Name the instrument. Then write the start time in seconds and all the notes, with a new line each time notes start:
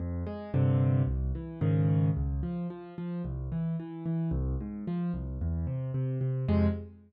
acoustic grand piano
0.00 F2
0.26 G#3
0.54 G2 C3 D3
1.07 C2
1.35 E3
1.61 G#2 C#3 D#3
2.17 C#2
2.43 F3
2.70 F3
2.98 F3
3.25 C2
3.52 E3
3.80 E3
4.06 E3
4.31 C2
4.60 G#2
4.87 F3
5.14 C2
5.41 E2
5.67 C3
5.94 C3
6.21 C3
6.48 F2 C3 G#3